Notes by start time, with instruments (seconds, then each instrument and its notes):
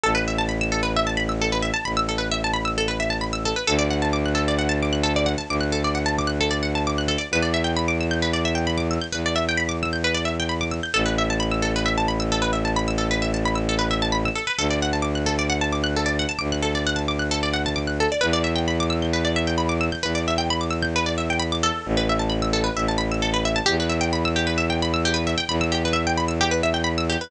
0.04 violin A1, pizzicato strings A4
0.15 pizzicato strings B4
0.28 pizzicato strings E5
0.38 pizzicato strings A5
0.49 pizzicato strings B5
0.61 pizzicato strings E6
0.72 pizzicato strings A4
0.83 pizzicato strings B4
0.96 pizzicato strings E5
1.07 pizzicato strings A5
1.17 pizzicato strings B5
1.29 pizzicato strings E6
1.41 pizzicato strings A4
1.52 pizzicato strings B4
1.62 pizzicato strings E5
1.74 pizzicato strings A5
1.85 violin A1, pizzicato strings B5
1.97 pizzicato strings E6
2.09 pizzicato strings A4
2.18 pizzicato strings B4
2.31 pizzicato strings E5
2.44 pizzicato strings A5
2.54 pizzicato strings B5
2.65 pizzicato strings E6
2.78 pizzicato strings A4
2.88 pizzicato strings B4
3.00 pizzicato strings E5
3.10 pizzicato strings A5
3.21 pizzicato strings B5
3.33 pizzicato strings E6
3.45 pizzicato strings A4
3.56 pizzicato strings B4
3.67 violin D2, pizzicato strings A4
3.79 pizzicato strings D5
3.90 pizzicato strings F#5
4.02 pizzicato strings A5
4.13 pizzicato strings D6
4.26 pizzicato strings F#6
4.35 pizzicato strings A4
4.48 pizzicato strings D5
4.59 pizzicato strings F#5
4.69 pizzicato strings A5
4.82 pizzicato strings D6
4.93 pizzicato strings F#6
5.03 pizzicato strings A4
5.16 pizzicato strings D5
5.26 pizzicato strings F#5
5.38 pizzicato strings A5
5.49 violin D2, pizzicato strings D6
5.61 pizzicato strings F#6
5.72 pizzicato strings A4
5.84 pizzicato strings D5
5.95 pizzicato strings F#5
6.06 pizzicato strings A5
6.18 pizzicato strings D6
6.27 pizzicato strings F#6
6.41 pizzicato strings A4
6.51 pizzicato strings D5
6.63 pizzicato strings F#5
6.75 pizzicato strings A5
6.87 pizzicato strings D6
6.98 pizzicato strings F#6
7.08 pizzicato strings A4
7.18 pizzicato strings D5
7.31 violin E2, pizzicato strings B4
7.42 pizzicato strings D5
7.54 pizzicato strings E5
7.64 pizzicato strings G5
7.77 pizzicato strings B5
7.88 pizzicato strings D6
8.01 pizzicato strings E6
8.11 pizzicato strings G6
8.22 pizzicato strings B4
8.33 pizzicato strings D5
8.45 pizzicato strings E5
8.55 pizzicato strings G5
8.67 pizzicato strings B5
8.78 pizzicato strings D6
8.91 pizzicato strings E6
9.01 pizzicato strings G6
9.12 violin E2, pizzicato strings B4
9.26 pizzicato strings D5
9.36 pizzicato strings E5
9.49 pizzicato strings G5
9.57 pizzicato strings B5
9.69 pizzicato strings D6
9.83 pizzicato strings E6
9.93 pizzicato strings G6
10.04 pizzicato strings B4
10.14 pizzicato strings D5
10.25 pizzicato strings E5
10.40 pizzicato strings G5
10.49 pizzicato strings B5
10.61 pizzicato strings D6
10.71 pizzicato strings E6
10.83 pizzicato strings G6
10.94 violin A1, pizzicato strings A4
11.06 pizzicato strings B4
11.18 pizzicato strings E5
11.30 pizzicato strings A5
11.40 pizzicato strings B5
11.51 pizzicato strings E6
11.62 pizzicato strings A4
11.76 pizzicato strings B4
11.86 pizzicato strings E5
11.98 pizzicato strings A5
12.08 pizzicato strings B5
12.20 pizzicato strings E6
12.32 pizzicato strings A4
12.42 pizzicato strings B4
12.53 pizzicato strings E5
12.65 pizzicato strings A5
12.76 pizzicato strings B5
12.88 pizzicato strings E6
12.98 pizzicato strings A4
13.11 pizzicato strings B4
13.22 pizzicato strings E5
13.34 pizzicato strings A5
13.45 pizzicato strings B5
13.55 pizzicato strings E6
13.69 pizzicato strings A4
13.79 pizzicato strings B4
13.91 pizzicato strings E5
14.02 pizzicato strings A5
14.12 pizzicato strings B5
14.25 pizzicato strings E6
14.35 pizzicato strings A4
14.47 pizzicato strings B4
14.58 violin D2, pizzicato strings A4
14.70 pizzicato strings D5
14.82 pizzicato strings F#5
14.93 pizzicato strings A5
15.02 pizzicato strings D6
15.15 pizzicato strings F#6
15.26 pizzicato strings A4
15.39 pizzicato strings D5
15.50 pizzicato strings F#5
15.61 pizzicato strings A5
15.72 pizzicato strings D6
15.84 pizzicato strings F#6
15.96 pizzicato strings A4
16.06 pizzicato strings D5
16.19 pizzicato strings F#5
16.29 pizzicato strings A5
16.39 violin D2, pizzicato strings D6
16.52 pizzicato strings F#6
16.62 pizzicato strings A4
16.75 pizzicato strings D5
16.87 pizzicato strings F#5
16.96 pizzicato strings A5
17.08 pizzicato strings D6
17.19 pizzicato strings F#6
17.31 pizzicato strings A4
17.43 pizzicato strings D5
17.54 pizzicato strings F#5
17.66 pizzicato strings A5
17.76 pizzicato strings D6
17.87 pizzicato strings F#6
18.00 pizzicato strings A4
18.12 pizzicato strings D5
18.21 violin E2, pizzicato strings B4
18.33 pizzicato strings D5
18.44 pizzicato strings E5
18.55 pizzicato strings G5
18.68 pizzicato strings B5
18.80 pizzicato strings D6
18.90 pizzicato strings E6
19.02 pizzicato strings G6
19.13 pizzicato strings B4
19.25 pizzicato strings D5
19.36 pizzicato strings E5
19.47 pizzicato strings G5
19.58 pizzicato strings B5
19.69 pizzicato strings D6
19.81 pizzicato strings E6
19.92 pizzicato strings G6
20.03 violin E2, pizzicato strings B4
20.15 pizzicato strings D5
20.28 pizzicato strings E5
20.38 pizzicato strings G5
20.50 pizzicato strings B5
20.61 pizzicato strings D6
20.70 pizzicato strings E6
20.82 pizzicato strings G6
20.96 pizzicato strings B4
21.06 pizzicato strings D5
21.18 pizzicato strings E5
21.30 pizzicato strings G5
21.39 pizzicato strings B5
21.52 pizzicato strings D6
21.63 pizzicato strings A4
21.86 violin A1
21.97 pizzicato strings B4
22.09 pizzicato strings E5
22.19 pizzicato strings A5
22.30 pizzicato strings B5
22.42 pizzicato strings E6
22.53 pizzicato strings A4
22.64 pizzicato strings B4
22.77 violin A1, pizzicato strings E5
22.88 pizzicato strings A5
22.98 pizzicato strings B5
23.12 pizzicato strings E6
23.22 pizzicato strings A4
23.34 pizzicato strings B4
23.45 pizzicato strings E5
23.56 pizzicato strings A5
23.66 violin E2, pizzicato strings G4
23.80 pizzicato strings B4
23.89 pizzicato strings E5
24.01 pizzicato strings G5
24.13 pizzicato strings B5
24.25 pizzicato strings E6
24.36 pizzicato strings G4
24.47 pizzicato strings B4
24.58 pizzicato strings E5
24.70 pizzicato strings G5
24.82 pizzicato strings B5
24.94 pizzicato strings E6
25.05 pizzicato strings G4
25.14 pizzicato strings B4
25.27 pizzicato strings E5
25.38 pizzicato strings G5
25.49 violin E2, pizzicato strings B5
25.61 pizzicato strings E6
25.72 pizzicato strings G4
25.85 pizzicato strings B4
25.93 pizzicato strings E5
26.07 pizzicato strings G5
26.17 pizzicato strings B5
26.28 pizzicato strings E6
26.41 pizzicato strings G4
26.51 pizzicato strings B4
26.63 pizzicato strings E5
26.74 pizzicato strings G5
26.84 pizzicato strings B5
26.98 pizzicato strings E6
27.09 pizzicato strings G4
27.21 pizzicato strings B4